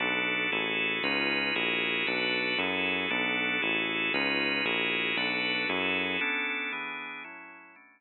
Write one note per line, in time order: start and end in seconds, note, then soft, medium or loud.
0.00 0.47 B1 medium
0.00 0.51 B3 medium
0.00 0.51 D4 medium
0.00 0.51 F#4 medium
0.00 0.51 A4 medium
0.52 0.99 A1 medium
0.52 1.03 E4 medium
0.52 1.03 F#4 medium
0.52 1.03 G#4 medium
0.52 1.03 A4 medium
1.03 1.51 C#2 medium
1.03 1.55 C#4 medium
1.03 1.55 D#4 medium
1.03 1.55 F4 medium
1.03 1.55 B4 medium
1.55 2.03 A#1 medium
1.55 2.07 E4 medium
1.55 2.06 F#4 medium
1.55 2.07 G#4 medium
1.55 2.07 A#4 medium
2.07 2.55 B1 medium
2.07 2.58 D4 medium
2.07 2.58 F#4 medium
2.07 2.58 A4 medium
2.07 2.58 B4 medium
2.58 3.06 F#2 medium
2.58 3.10 E4 medium
2.58 3.10 F#4 medium
2.58 3.10 G#4 medium
2.58 3.10 A4 medium
3.10 3.58 B1 medium
3.10 3.62 B3 medium
3.10 3.62 D4 medium
3.10 3.61 F#4 medium
3.10 3.61 A4 medium
3.62 4.10 A1 medium
3.62 4.13 E4 medium
3.62 4.13 F#4 medium
3.62 4.13 G#4 medium
3.62 4.13 A4 medium
4.14 4.61 C#2 medium
4.14 4.65 C#4 medium
4.14 4.65 D#4 medium
4.14 4.65 F4 medium
4.14 4.65 B4 medium
4.65 5.13 A#1 medium
4.65 5.17 E4 medium
4.65 5.17 F#4 medium
4.65 5.17 G#4 medium
4.65 5.17 A#4 medium
5.17 5.65 B1 medium
5.17 5.68 D4 medium
5.17 5.68 F#4 medium
5.17 5.68 A4 medium
5.17 5.68 B4 medium
5.69 6.17 F#2 medium
5.69 6.20 E4 medium
5.69 6.20 F#4 medium
5.69 6.20 G#4 medium
5.69 6.20 A4 medium
6.21 6.72 B3 medium
6.21 6.72 C#4 medium
6.21 6.72 D4 medium
6.21 6.72 A4 medium
6.72 7.24 E3 medium
6.72 7.24 B3 medium
6.72 7.24 D4 medium
6.72 7.24 G#4 medium
7.24 7.75 A2 medium
7.24 7.75 F#3 medium
7.24 7.75 C#4 medium
7.24 7.75 E4 medium
7.76 8.01 B2 medium
7.76 8.01 A3 medium
7.76 8.01 C#4 medium
7.76 8.01 D4 medium